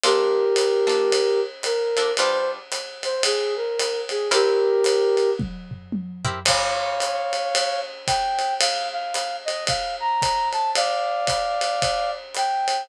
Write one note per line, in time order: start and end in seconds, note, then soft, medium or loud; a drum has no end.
0.04 0.45 A#3 loud
0.04 0.45 D4 loud
0.04 0.45 F4 loud
0.04 1.40 G4 medium
0.04 0.45 A4 loud
0.04 1.40 A#4 medium
0.04 ride loud
0.56 hi-hat pedal medium
0.56 ride loud
0.87 1.21 A#3 medium
0.87 1.21 D4 medium
0.87 1.21 F4 medium
0.87 1.21 A4 medium
0.87 ride medium
1.12 ride loud
1.63 2.12 A#4 medium
1.63 hi-hat pedal medium
1.63 ride medium
1.97 2.12 A#3 medium
1.97 2.12 D4 medium
1.97 2.12 F4 medium
1.97 2.12 A4 loud
1.97 ride medium
2.17 2.59 G3 loud
2.17 2.59 D4 loud
2.17 2.59 F4 loud
2.17 2.59 B4 loud
2.17 2.50 C5 medium
2.17 ride loud
2.72 hi-hat pedal medium
2.72 ride medium
3.03 3.23 C5 medium
3.03 ride medium
3.23 3.54 G#4 medium
3.23 ride loud
3.56 4.01 A#4 medium
3.79 hi-hat pedal medium
3.79 ride medium
4.09 4.29 G#4 medium
4.09 ride medium
4.31 4.72 C4 loud
4.31 4.72 E4 loud
4.31 4.72 G4 loud
4.31 5.30 G4 medium
4.31 4.72 A#4 loud
4.31 5.30 A#4 medium
4.31 ride loud
4.84 hi-hat pedal medium
4.84 ride loud
5.17 ride medium
5.39 kick medium
5.39 high tom medium
5.71 floor tom medium
5.92 high tom medium
6.25 6.40 C4 medium
6.25 6.40 E4 medium
6.25 6.40 G4 medium
6.25 6.40 A#4 loud
6.25 floor tom loud
6.45 7.80 C#5 medium
6.45 7.80 F5 medium
6.45 kick medium
6.45 crash loud
6.45 ride loud
7.00 hi-hat pedal medium
7.00 ride medium
7.33 ride medium
7.55 ride loud
8.07 8.54 G5 medium
8.07 kick medium
8.07 hi-hat pedal medium
8.07 ride medium
8.39 ride medium
8.60 8.89 F5 medium
8.60 ride loud
8.93 9.36 F5 medium
9.14 hi-hat pedal medium
9.14 ride medium
9.45 9.65 D#5 medium
9.45 ride medium
9.67 9.96 F5 medium
9.67 kick medium
9.67 ride loud
10.00 10.49 A#5 medium
10.22 kick medium
10.22 hi-hat pedal medium
10.22 ride medium
10.53 10.71 A5 medium
10.53 ride medium
10.75 12.11 D5 medium
10.75 12.11 F5 medium
10.75 ride loud
11.27 kick medium
11.27 hi-hat pedal medium
11.27 ride medium
11.61 ride medium
11.82 kick medium
11.82 ride loud
12.35 12.83 G5 medium
12.35 hi-hat pedal medium
12.35 ride medium
12.68 ride medium